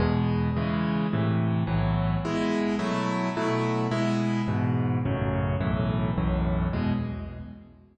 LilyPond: \new Staff { \time 6/8 \key e \major \tempo 4. = 107 <e, b, gis>4. <cis e gis>4. | <a, c e>4. <b,, a, e fis>4. | <b, gis e'>4. <b, fis a e'>4. | <b, fis a e'>4. <b, gis e'>4. |
<e, gis, b,>4. <a,, fis, cis>4. | <b,, fis, a, e>4. <b,, fis, a, e>4. | <e, b, gis>4. r4. | }